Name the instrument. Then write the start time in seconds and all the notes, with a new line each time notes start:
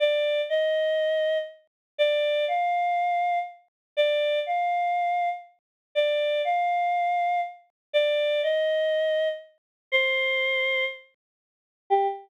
choir aahs
0.00 D5
0.49 D#5
1.98 D5
2.48 F5
3.97 D5
4.46 F5
5.95 D5
6.45 F5
7.93 D5
8.43 D#5
9.92 C5
11.90 G4